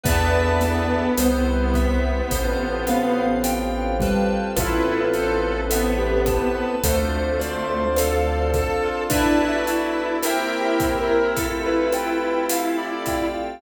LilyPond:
<<
  \new Staff \with { instrumentName = "Acoustic Grand Piano" } { \time 4/4 \key a \minor \tempo 4 = 53 b8 b4. r8 b4 g8 | <f' a'>4 a'16 g'8 b'16 a'16 r16 c''16 c''16 a'8. f'16 | d'16 fis'8. \tuplet 3/2 { g'8 g'8 bes'8 } r16 b'16 b'8 r16 d''8 r16 | }
  \new Staff \with { instrumentName = "Lead 2 (sawtooth)" } { \time 4/4 \key a \minor b2. r4 | e'8 a'8 b4 a4 a'8 a'8 | e'1 | }
  \new Staff \with { instrumentName = "Electric Piano 2" } { \time 4/4 \key a \minor <b' d'' e'' a''>4 c''8 e''8 c''8 f''8 g''8 b'8~ | b'8 c''8 e''8 a''8 c''8 d''8 f''8 a''8 | <b' d'' e'' a''>4 <bes' c'' e'' g''>4 a'8 g''8 f''8 g''8 | }
  \new Staff \with { instrumentName = "Electric Piano 2" } { \time 4/4 \key a \minor <b' d'' e'' a''>4 c''8 e''8 c''8 f''8 g''8 a''8 | b'8 c''8 e''8 a''8 c''8 d''8 f''8 a''8 | <b' d'' e'' a''>4 <bes' c'' e'' g''>4 a'8 g''8 a'8 f''8 | }
  \new Staff \with { instrumentName = "Synth Bass 1" } { \clef bass \time 4/4 \key a \minor e,4 c,4 a,,2 | a,,2 d,2 | r1 | }
  \new Staff \with { instrumentName = "Pad 5 (bowed)" } { \time 4/4 \key a \minor <b d' e' a'>4 <c' e' g'>4 <c' f' g' a'>2 | <b c' e' a'>2 <c' d' f' a'>2 | <b d' e' a'>4 <bes c' e' g'>4 <a c' f' g'>2 | }
  \new DrumStaff \with { instrumentName = "Drums" } \drummode { \time 4/4 <hh bd>8 <hh sn>8 <hh ss>8 <hh bd>8 <hh bd>8 <hh ss>8 hh8 <hh bd>8 | <hh bd ss>8 hh8 hh8 <hh bd ss>8 <hh bd>8 hh8 <hh ss>8 <hh bd>8 | <hh bd>8 hh8 <hh ss>8 <hh bd>8 <hh bd>8 <hh ss>8 hh8 <hh bd>8 | }
>>